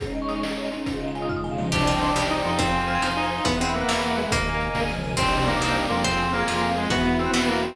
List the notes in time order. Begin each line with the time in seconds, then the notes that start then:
0.00 G#3 C#4 D#4 G#4, kick, closed hi-hat
0.05 D#4 C#5
0.15 D#5
0.22 C#6
0.29 D#6, closed hi-hat
0.36 C#6
0.43 G#3 C#4 D#5, snare
0.47 D#4 G#4
0.58 C#5
0.65 D#5
0.72 C#4, closed hi-hat
0.86 C#3 G#3 D#4 F4, kick, closed hi-hat
0.92 D#4 F4 G#4
1.01 D#5
1.08 F5
1.15 G#5, closed hi-hat
1.22 D#6
1.29 C#3 G#3 F6, kick, floor tom
1.35 D#4 F4 D#6
1.44 G#5, mid tom
1.51 F5
1.58 D#5, high tom
1.65 C#4
1.72 C2 D4 G4 C5 D5 D#5 G5, kick, crash
1.77 D5 D#5 G5
1.87 F4 D#5
1.94 G5
2.01 C6, closed hi-hat
2.09 D6
2.16 C2 G3 G4 C5 D5 G5 D#6, snare
2.23 G6
2.30 D#4 D#6
2.37 D6
2.44 F2 C6, closed hi-hat
2.52 G5
2.59 C4 C5 F5 G#5, kick, closed hi-hat
2.64 F5 G#5
2.73 G#5
2.81 C6
2.88 F6, closed hi-hat
2.95 G#6
3.02 F2 D#4 C5 G#5 C6 F6, snare
3.09 C6
3.16 D#4 G#5
3.24 F5
3.31 C5, closed hi-hat
3.38 F5
3.44 E2 B3 B4 E5 F#5, kick, closed hi-hat
3.50 E5 F#5
3.60 G#3 C4 F#5
3.67 B5
3.74 A#3 E6, closed hi-hat
3.81 F#6
3.88 E2 E3 B4 F#5 B5 E6, snare
3.95 B5
4.03 F#5
4.10 E5
4.17 G#3 B4, closed hi-hat
4.24 E5
4.30 D#2 A#3 A#4 D#5 G#5, kick, closed hi-hat
4.34 D#5 G#5
4.60 closed hi-hat
4.75 D2 G#4 A#4 G#5, kick, snare
4.89 high tom
4.96 C#2
5.04 mid tom
5.17 C2 C4 D4 D#4 G4 C5, kick, crash
5.22 D#4 G4 D5
5.33 D#5
5.39 G5
5.46 A#3 C6, closed hi-hat
5.54 D6
5.60 C2 G3 C4 D4 G4 D#6, snare
5.68 G6
5.75 D#6
5.83 D6
5.90 F2 A#3 C4 F4 C6, closed hi-hat
5.95 G#4 G5
6.04 C4 F4 G#4 C5, kick, closed hi-hat
6.11 F5
6.19 G#5
6.26 C6
6.33 A#3 F6, closed hi-hat
6.40 G#6
6.47 F2 C4 F4 G#4 C5 F6, snare
6.55 C6
6.62 G#5
6.69 F5
6.76 G#3 C5, closed hi-hat
6.83 F5
6.90 E2 B3 E4 F#4 B4, kick, closed hi-hat
6.95 F#4 E5
7.05 F#5
7.13 B5
7.19 C4 E6, closed hi-hat
7.26 F#6
7.33 E2 B3 F#4 B4 E6, snare
7.41 B5
7.47 A#3 F#5
7.55 E5
7.62 C4 B4, closed hi-hat
7.69 E5